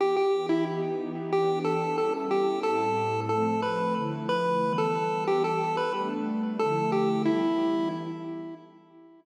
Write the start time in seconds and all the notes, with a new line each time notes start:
0.00 E3 B3 G4 G5
0.16 G4 G5
0.49 E4 E5
0.67 E3 B3 D#4 G4
1.32 E3 B3 D4 G4 G5
1.64 A4 A5
1.97 G3 B3 C#4 E4 A4 A5
2.31 G4 G5
2.63 A2 G3 C4 E4 A4 A5
3.29 F3 A3 C4 A4 A5
3.62 B4 B5
3.95 D3 F3 A3 E4
4.29 B4 B5
4.62 E3 G3 B3
4.78 A4 A5
5.26 E3 G3 B3 G4 G5
5.44 A4 A5
5.77 B4 B5
5.93 G3 A3 B3 D4
6.59 D3 F3 A3 E4 A4 A5
6.92 G4 G5
7.25 E3 G3 B3 E4 E5